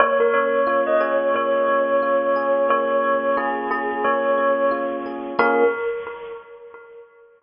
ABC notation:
X:1
M:4/4
L:1/16
Q:"Swing 16ths" 1/4=89
K:Bbdor
V:1 name="Tubular Bells"
d B d3 e d2 d8 | d4 A z A2 d4 z4 | B4 z12 |]
V:2 name="Electric Piano 1"
B,2 D2 F2 A2 B,2 D2 F2 A2 | B,2 D2 F2 A2 B,2 D2 F2 A2 | [B,DFA]4 z12 |]